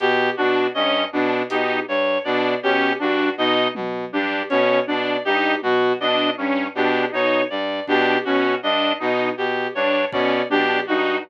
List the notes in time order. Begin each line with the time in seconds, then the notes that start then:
0.00 B2 G4, closed hi-hat
0.37 B2 D4 F#4
0.74 G2 C#4 D#5
1.13 B2 D4
1.50 B2 D#4 G4, closed hi-hat
1.88 G2 C#5
2.24 B2 D4 D5
2.62 B2 C#4 G4
2.99 G2 D4 F#4, cowbell
3.37 B2 D#4 D#5
3.75 B2, high tom
4.13 G2 D4 G4
4.50 B2 C#4 C#5, closed hi-hat
4.87 B2 D4 D5
5.25 G2 D#4 G4
5.62 B2 F#4, high tom
6.00 B2 D4 D#5
6.38 G2 C#4
6.75 B2 D4 G4
7.12 B2 D#4 C#5
7.50 G2 D5
7.87 B2 D4 G4, kick
8.25 B2 C#4 F#4
8.62 G2 D4 D#5
8.99 B2 D#4
9.37 B2 G4
9.75 G2 D4 C#5
10.12 B2 C#4 D5, kick
10.50 B2 D4 G4, high tom
10.87 G2 D#4 F#4